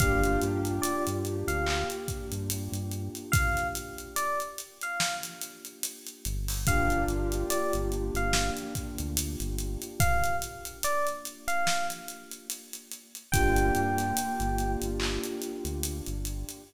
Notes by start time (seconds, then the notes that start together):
0.00 G1 A#3 D4 F4 G4 F5, kick, closed hi-hat
0.24 closed hi-hat
0.41 G2, closed hi-hat
0.65 closed hi-hat
0.82 D5, closed hi-hat
1.07 G2, closed hi-hat
1.25 closed hi-hat
1.47 D2 F5, closed hi-hat
1.66 clap
1.90 closed hi-hat
2.08 kick, closed hi-hat
2.32 G2, closed hi-hat
2.50 closed hi-hat
2.72 G2, closed hi-hat
2.91 closed hi-hat
3.15 closed hi-hat
3.32 F5, kick, closed hi-hat
3.57 snare, closed hi-hat
3.75 closed hi-hat
3.98 closed hi-hat
4.16 D5, closed hi-hat
4.40 closed hi-hat
4.58 closed hi-hat
4.81 F5, closed hi-hat
5.00 snare
5.23 snare, closed hi-hat
5.41 closed hi-hat
5.65 closed hi-hat
5.83 closed hi-hat
6.07 closed hi-hat
6.25 G1, closed hi-hat
6.48 open hi-hat
6.67 A#3 D4 F4 G4 F5, kick, closed hi-hat
6.90 closed hi-hat
7.07 G1, closed hi-hat
7.32 closed hi-hat
7.50 D5, closed hi-hat
7.73 G1, closed hi-hat
7.92 closed hi-hat
8.14 G1 F5, closed hi-hat
8.33 snare
8.57 closed hi-hat
8.75 kick, closed hi-hat
8.98 D2, closed hi-hat
9.17 closed hi-hat
9.40 G1, closed hi-hat
9.59 closed hi-hat
9.82 closed hi-hat
10.00 F5, kick, closed hi-hat
10.24 closed hi-hat
10.42 closed hi-hat
10.65 closed hi-hat
10.83 D5, closed hi-hat
11.07 closed hi-hat
11.25 closed hi-hat
11.48 F5, closed hi-hat
11.67 snare
11.90 snare, closed hi-hat
12.08 closed hi-hat
12.31 closed hi-hat
12.50 closed hi-hat
12.73 closed hi-hat
12.91 closed hi-hat
13.15 closed hi-hat
13.32 G1 A#3 D4 F4 G4 G5, kick, closed hi-hat
13.56 closed hi-hat
13.75 G2, closed hi-hat
13.98 snare, closed hi-hat
14.17 closed hi-hat
14.40 G1, closed hi-hat
14.59 closed hi-hat
14.82 G1, closed hi-hat
15.00 clap
15.24 closed hi-hat
15.42 closed hi-hat
15.65 D2, closed hi-hat
15.83 closed hi-hat
16.06 G1, closed hi-hat
16.25 closed hi-hat
16.49 closed hi-hat